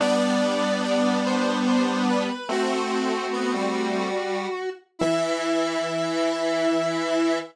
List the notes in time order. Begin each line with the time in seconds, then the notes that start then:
0.00 G3 B3 D4 D5
0.83 D5
1.25 C5
1.67 C5
2.08 B4
2.49 A3 C4 F#4
3.33 B3
3.54 G3
4.99 E3 E4 E5